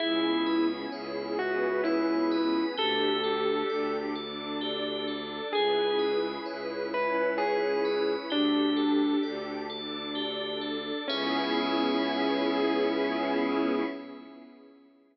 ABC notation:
X:1
M:3/4
L:1/16
Q:1/4=65
K:C#phr
V:1 name="Electric Piano 1"
E3 z3 F2 E4 | A6 z6 | G3 z3 B2 G4 | D4 z8 |
C12 |]
V:2 name="Tubular Bells"
G2 B2 c2 e2 c2 B2 | =G2 A2 d2 A2 G2 A2 | G2 B2 c2 e2 c2 B2 | =G2 A2 d2 A2 G2 A2 |
[GBce]12 |]
V:3 name="Violin" clef=bass
C,,4 C,,8 | D,,4 D,,8 | C,,4 C,,8 | D,,4 D,,8 |
C,,12 |]
V:4 name="Pad 5 (bowed)"
[B,CEG]6 [B,CGB]6 | [D=GA]6 [DAd]6 | [CEGB]6 [CEBc]6 | [D=GA]6 [DAd]6 |
[B,CEG]12 |]